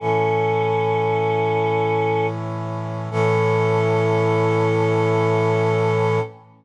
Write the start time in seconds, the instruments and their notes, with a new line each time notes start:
0.00 brass section A2 E3 C#4, choir aahs C#4 A4
3.11 brass section A2 E3 C#4, choir aahs A4